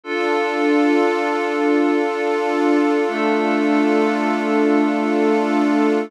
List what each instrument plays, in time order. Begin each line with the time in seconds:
0.04 pad 5 (bowed) D4 F4 A4, pad 2 (warm) D4 F4 A4
3.08 pad 5 (bowed) A3 D4 A4